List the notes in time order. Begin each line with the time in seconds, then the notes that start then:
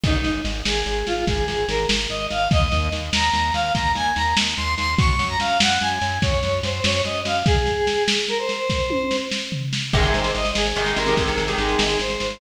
0.03 G#1 D#4, kick, snare, crash
0.24 G#1, snare
0.45 G#1, snare
0.65 G#1 G#4, snare
0.86 G#1, snare
1.07 G#1 F4, snare
1.27 G#1 G#4, kick, snare
1.48 G#1 G#4, snare
1.68 G#1 A#4, snare
1.89 G#1, snare
2.10 G#1 D#5, snare
2.30 G#1 F5, snare
2.51 D#2 D#5, kick, snare
2.72 D#2, snare
2.92 D#2, snare
3.12 D#2 A#5, snare
3.33 D#2, snare
3.54 D#2 F5, snare
3.75 D#2 A#5, kick, snare
3.95 D#2 G#5, snare
4.16 D#2 A#5, snare
4.37 D#2, snare
4.57 D#2 C6, snare
4.78 D#2 C6, snare
4.98 F#2 C#6, kick, snare
5.19 F#2, snare
5.29 A#5
5.40 F#2 F5, snare
5.60 F#2 F#5, snare
5.81 F#2 G#5, snare
6.01 F#2, snare
6.22 F#2 C#5, kick, snare
6.43 F#2, snare
6.63 F#2 C5, snare
6.84 F#2 C#5, snare
7.05 F#2 D#5, snare
7.25 F#2 F5, snare
7.46 G#4, kick, snare
7.66 snare
7.87 snare
8.08 snare
8.28 A#4, snare
8.38 C5
8.49 snare
8.70 kick, snare
8.90 high tom
9.11 snare
9.31 snare
9.52 floor tom
9.73 snare
9.93 G#1 C3 D#3 G#3 G#4, kick, snare, crash
10.04 snare
10.14 G#1 C5, snare
10.24 snare
10.34 G#1 D#5, snare
10.45 snare
10.55 G#1 G#4, snare
10.65 snare
10.76 G#1 C3 D#3 G#3, snare
10.86 snare
10.96 G#1 C3 D#3 G#3 A#4, snare
11.07 C3 D#3 G#3, snare
11.17 G#1, kick, snare
11.27 C3 D#3 G#3, snare
11.37 G#1, snare
11.48 C3 D#3 G#3, snare
11.58 G#1 G#4, snare
11.69 snare
11.79 G#1, snare
11.89 snare
11.99 G#1 C5, snare
12.10 snare
12.20 G#1, snare
12.30 snare